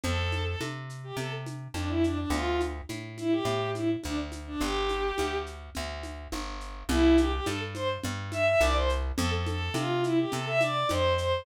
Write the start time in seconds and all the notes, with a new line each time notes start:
0.04 F2 A4, low conga, shaker
0.32 high conga, shaker
0.46 A4
0.61 C3, high conga, shaker
0.90 shaker
1.04 G4
1.17 C3 A4, low conga, shaker
1.46 high conga, shaker
1.74 F2 D4, high conga, shaker
1.89 E4
2.04 D4, shaker
2.18 D4
2.30 D2 F4, low conga, shaker
2.61 high conga, shaker
2.89 A2, high conga, shaker
3.18 E4, high conga, shaker
3.31 G4
3.45 A2, low conga, shaker
3.75 E4, high conga, shaker
4.03 D2 D4, high conga, shaker
4.32 high conga, shaker
4.47 D4
4.61 G1 G4, low conga, shaker
4.89 high conga, shaker
5.18 D2, high conga, shaker
5.46 shaker
5.75 D2, low conga, shaker
6.03 high conga, shaker
6.32 G1, high conga, shaker
6.61 shaker
6.89 C2 E4, low conga, shaker
7.18 G4, high conga, shaker
7.32 G4
7.46 G2 A4, high conga, shaker
7.74 C5, high conga, shaker
8.03 G2, low conga, shaker
8.32 E5, high conga, shaker
8.46 E5
8.60 C2 D5, high conga, shaker
8.75 C5
8.89 shaker
9.17 F2 A4, low conga, shaker
9.32 A4
9.47 A4, high conga, shaker
9.74 C3 F4, high conga, shaker
10.03 E4, shaker
10.18 G4
10.32 C3 A4, low conga, shaker
10.46 E5
10.61 D5, high conga, shaker
10.89 F2 C5, high conga, shaker
11.17 C5, shaker